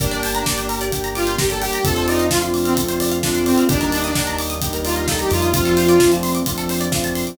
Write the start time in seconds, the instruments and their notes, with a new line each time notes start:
0.00 synth bass 1 G1, lead 2 (sawtooth) A#3 D4 G4, pad 5 (bowed) A#3 D4 G4, pizzicato strings A#4, kick, closed hi-hat
0.11 pizzicato strings D5, closed hi-hat
0.23 pizzicato strings G5, open hi-hat
0.34 lead 2 (sawtooth) D4, pizzicato strings A#5, closed hi-hat
0.46 lead 2 (sawtooth) A#3 D4 G4, pizzicato strings D6, kick, snare
0.58 pizzicato strings G6, closed hi-hat
0.69 pizzicato strings A#4, open hi-hat
0.81 pizzicato strings D5, closed hi-hat
0.92 pad 5 (bowed) G3 A#3 G4, lead 2 (sawtooth) A#3 D4 G4, pizzicato strings G5, kick, closed hi-hat
1.04 pizzicato strings A#5, closed hi-hat
1.15 lead 2 (sawtooth) F4, pizzicato strings D6, open hi-hat
1.27 pizzicato strings G6, closed hi-hat
1.38 lead 2 (sawtooth) A#3 D4 G4, pizzicato strings A#4, kick, snare
1.50 lead 2 (sawtooth) A4, pizzicato strings D5, closed hi-hat
1.62 lead 2 (sawtooth) G4, pizzicato strings G5, open hi-hat
1.73 pizzicato strings A#5, closed hi-hat
1.84 synth bass 1 F2, lead 2 (sawtooth) A3 C4 D4 F4 A4, pad 5 (bowed) A3 C4 D4 F4, pizzicato strings A4, kick, closed hi-hat
1.96 pizzicato strings C5, closed hi-hat
2.08 lead 2 (sawtooth) D#4, pizzicato strings D5, open hi-hat
2.19 pizzicato strings F5, closed hi-hat
2.31 lead 2 (sawtooth) A3 C4 D4 F4, pizzicato strings A5, kick, snare
2.42 pizzicato strings C6, closed hi-hat
2.54 pizzicato strings D6, open hi-hat
2.65 lead 2 (sawtooth) C4, pizzicato strings F6, closed hi-hat
2.77 lead 2 (sawtooth) A3 C4 D4 F4, pad 5 (bowed) A3 C4 F4 A4, pizzicato strings A4, kick, closed hi-hat
2.88 pizzicato strings C5, closed hi-hat
3.00 pizzicato strings D5, open hi-hat
3.11 pizzicato strings F5, closed hi-hat
3.23 lead 2 (sawtooth) A3 C4 D4 F4, pizzicato strings A5, kick, snare
3.35 pizzicato strings C6, closed hi-hat
3.46 lead 2 (sawtooth) C4, pizzicato strings D6, open hi-hat
3.57 pizzicato strings F6, closed hi-hat
3.69 synth bass 1 D#2, lead 2 (sawtooth) G3 A#3 D4 D#4, pad 5 (bowed) G3 A#3 D4 D#4, pizzicato strings G4, kick, closed hi-hat
3.81 pizzicato strings A#4, closed hi-hat
3.92 pizzicato strings D5, open hi-hat
4.04 lead 2 (sawtooth) D4, pizzicato strings D#5, closed hi-hat
4.15 lead 2 (sawtooth) G3 A#3 D4 D#4, pizzicato strings G5, kick, snare
4.27 pizzicato strings A#5, closed hi-hat
4.38 pizzicato strings D6, open hi-hat
4.50 pizzicato strings D#6, closed hi-hat
4.61 pad 5 (bowed) G3 A#3 D#4 G4, lead 2 (sawtooth) G3 A#3 D4 D#4, pizzicato strings G4, kick, closed hi-hat
4.73 pizzicato strings A#4, closed hi-hat
4.85 lead 2 (sawtooth) F4, pizzicato strings D5, open hi-hat
4.96 pizzicato strings D#5, closed hi-hat
5.07 lead 2 (sawtooth) G3 A#3 D4 D#4 A4, pizzicato strings G5, kick, snare
5.19 lead 2 (sawtooth) G4, pizzicato strings A#5, closed hi-hat
5.30 synth bass 1 F2, lead 2 (sawtooth) F4, pizzicato strings D6, open hi-hat
5.42 pizzicato strings D#6, closed hi-hat
5.54 pad 5 (bowed) F3 A3 C4 D4, lead 2 (sawtooth) F3 A3 C4 D4 F4, pizzicato strings F4, kick, closed hi-hat
5.65 pizzicato strings A4, closed hi-hat
5.77 pizzicato strings C5, open hi-hat
5.88 pizzicato strings D5, closed hi-hat
5.99 lead 2 (sawtooth) F3 A3 C4 D4, pizzicato strings F5, kick, snare
6.12 pizzicato strings A5, closed hi-hat
6.23 pizzicato strings C6, open hi-hat
6.35 pizzicato strings D6, closed hi-hat
6.46 lead 2 (sawtooth) F3 A3 C4 D4, pad 5 (bowed) F3 A3 D4 F4, pizzicato strings F4, kick, closed hi-hat
6.58 pizzicato strings A4, closed hi-hat
6.69 pizzicato strings C5, open hi-hat
6.80 pizzicato strings D5, closed hi-hat
6.92 lead 2 (sawtooth) F3 A3 C4 D4, pizzicato strings F5, kick, snare
7.04 pizzicato strings A5, closed hi-hat
7.15 pizzicato strings C6, open hi-hat
7.27 pizzicato strings D6, closed hi-hat